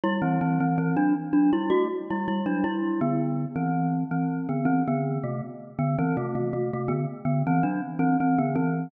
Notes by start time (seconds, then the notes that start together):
0.04 G3 E4
0.22 E3 C4
0.41 E3 C4
0.60 E3 C4
0.78 E3 C4
0.96 F#3 D4
1.33 F#3 D4
1.53 G3 E4
1.70 A3 F#4
2.10 G3 E4
2.28 G3 E4
2.46 F#3 D4
2.64 G3 E4
3.01 D3 B3
3.56 E3 C4
4.11 E3 C4
4.49 D3 B3
4.65 E3 C4
4.88 D3 B3
5.23 C3 A3
5.79 D3 B3
5.98 E3 C4
6.17 C3 A3
6.35 C3 A3
6.53 C3 A3
6.73 C3 A3
6.88 D3 B3
7.25 D3 B3
7.47 E3 C4
7.63 F#3 D4
7.99 E3 C4
8.20 E3 C4
8.38 D3 B3
8.55 E3 C4